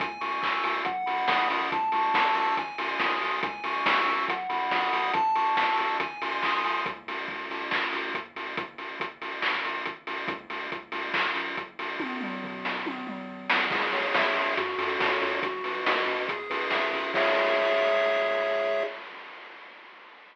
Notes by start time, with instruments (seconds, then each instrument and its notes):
0.00 synth bass 1 C#2, lead 1 (square) G#5, kick, closed hi-hat
0.21 synth bass 1 C#2, lead 1 (square) C#6, open hi-hat
0.42 synth bass 1 C#2, lead 1 (square) E6, kick, clap
0.64 synth bass 1 C#2, lead 1 (square) G#5, open hi-hat
0.85 synth bass 1 B1, lead 1 (square) F#5, kick, closed hi-hat
1.06 synth bass 1 B1, lead 1 (square) B5, open hi-hat
1.28 synth bass 1 B1, lead 1 (square) D#6, kick, snare
1.49 synth bass 1 B1, lead 1 (square) F#5, open hi-hat
1.72 synth bass 1 C#2, lead 1 (square) A5, kick, closed hi-hat
1.92 synth bass 1 C#2, lead 1 (square) C#6, open hi-hat
2.14 synth bass 1 C#2, lead 1 (square) E6, kick, snare
2.35 synth bass 1 C#2, lead 1 (square) A5, open hi-hat
2.57 synth bass 1 G#1, lead 1 (square) G#5, kick, closed hi-hat
2.78 synth bass 1 G#1, lead 1 (square) C6, open hi-hat
2.99 synth bass 1 G#1, lead 1 (square) D#6, kick, snare
3.22 synth bass 1 G#1, lead 1 (square) G#5, open hi-hat
3.43 synth bass 1 C#2, lead 1 (square) G#5, kick, closed hi-hat
3.64 synth bass 1 C#2, lead 1 (square) C#6, open hi-hat
3.85 synth bass 1 C#2, lead 1 (square) E6, kick, snare
4.06 synth bass 1 C#2, lead 1 (square) G#5, open hi-hat
4.28 synth bass 1 B1, lead 1 (square) F#5, kick, closed hi-hat
4.49 synth bass 1 B1, lead 1 (square) B5, open hi-hat
4.71 synth bass 1 B1, lead 1 (square) D#6, kick, snare
4.93 synth bass 1 B1, lead 1 (square) F#5, open hi-hat
5.13 synth bass 1 A1, lead 1 (square) A5, kick, closed hi-hat
5.35 synth bass 1 A1, lead 1 (square) C#6, open hi-hat
5.57 synth bass 1 A1, lead 1 (square) E6, kick, snare
5.77 synth bass 1 A1, lead 1 (square) A5, open hi-hat
6.00 synth bass 1 G#1, lead 1 (square) G#5, kick, closed hi-hat
6.22 synth bass 1 G#1, lead 1 (square) C6, open hi-hat
6.43 synth bass 1 B1, lead 1 (square) D#6, kick, clap
6.64 synth bass 1 C2, lead 1 (square) G#5, open hi-hat
6.86 synth bass 1 C#2, kick, closed hi-hat
7.07 synth bass 1 C#2, open hi-hat
7.28 synth bass 1 C#2, kick
7.50 synth bass 1 C#2, open hi-hat
7.71 synth bass 1 D#2, kick, clap
7.93 synth bass 1 D#2, open hi-hat
8.14 synth bass 1 D#2, kick, closed hi-hat
8.36 synth bass 1 D#2, open hi-hat
8.57 synth bass 1 A1, kick, closed hi-hat
8.78 synth bass 1 A1, open hi-hat
9.00 synth bass 1 A1, kick, closed hi-hat
9.22 synth bass 1 A1, open hi-hat
9.42 synth bass 1 G#1, kick, clap
9.64 synth bass 1 G#1, open hi-hat
9.86 synth bass 1 G#1, kick, closed hi-hat
10.07 synth bass 1 G#1, open hi-hat
10.28 synth bass 1 C#2, kick, closed hi-hat
10.50 synth bass 1 C#2, open hi-hat
10.72 synth bass 1 C#2, kick, closed hi-hat
10.92 synth bass 1 C#2, open hi-hat
11.14 synth bass 1 B1, kick, clap
11.35 synth bass 1 B1, open hi-hat
11.57 synth bass 1 B1, kick, closed hi-hat
11.79 synth bass 1 B1, open hi-hat
11.99 synth bass 1 A1, kick, high tom
12.21 synth bass 1 A1, mid tom
12.43 synth bass 1 A1, floor tom
12.64 synth bass 1 A1, snare
12.86 synth bass 1 G#1, high tom
13.07 synth bass 1 G#1, mid tom
13.29 synth bass 1 G#1
13.50 synth bass 1 G#1, snare
13.71 synth bass 1 C#2, lead 1 (square) G#4, kick, crash
13.92 synth bass 1 C#2, lead 1 (square) C#5, open hi-hat
14.14 synth bass 1 C#2, lead 1 (square) E5, kick, snare
14.36 synth bass 1 C#2, lead 1 (square) G#4, open hi-hat
14.57 synth bass 1 F#2, lead 1 (square) F#4, kick, closed hi-hat
14.78 synth bass 1 F#2, lead 1 (square) A4, open hi-hat
15.00 synth bass 1 F#2, lead 1 (square) C#5, kick, snare
15.21 synth bass 1 F#2, lead 1 (square) F#4, open hi-hat
15.42 synth bass 1 B1, lead 1 (square) F#4, kick, closed hi-hat
15.64 synth bass 1 B1, lead 1 (square) B4, open hi-hat
15.85 synth bass 1 B1, lead 1 (square) D#5, kick, snare
16.06 synth bass 1 E2, lead 1 (square) F#4, open hi-hat
16.28 lead 1 (square) G#4, kick, closed hi-hat
16.50 synth bass 1 E2, lead 1 (square) B4, open hi-hat
16.70 synth bass 1 E2, lead 1 (square) E5, kick, snare
16.93 synth bass 1 E2, lead 1 (square) G#4, open hi-hat
17.14 synth bass 1 C#2, lead 1 (square) G#4 C#5 E5, kick, crash